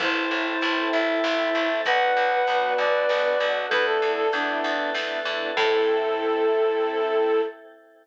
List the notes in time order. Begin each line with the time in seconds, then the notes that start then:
0.00 A1 C4 E4 A4 C5 E5 A5, kick, crash
0.16 C4 E4 A4
0.31 A1
0.61 A1 C4 E4 A4, closed hi-hat
0.92 A1 A4 C5 E5 A5
1.08 C4 E4 A4
1.24 A1 C4 E4 A4, snare
1.55 A1 C4 E4 A4
1.85 B1 B3 D4 F#4 B4 D5 F#5, kick, closed hi-hat
2.01 B3 D4 F#4
2.16 B1
2.47 B1 B3 D4 F#4, closed hi-hat
2.78 B1 F#4 B4 D5 F#5
2.94 B3 D4 F#4
3.09 B1 B3 D4 F#4, snare
3.40 B1 B3 D4 F#4
3.69 E2 A3 B3 D4 E4 A4 B4 D5 E5, kick, closed hi-hat
3.87 A3 B3 D4 E4 A4
4.02 E2
4.17 A4
4.33 E2 A3 B3 D4 E4, closed hi-hat
4.64 E2 A4 B4 E5 A5
4.79 A3 B3 D4 E4
4.94 E2 A3 B3 D4 E4, snare
5.25 E2 A3 B3 D4 E4
5.56 A2 C4 E4 A4, kick, crash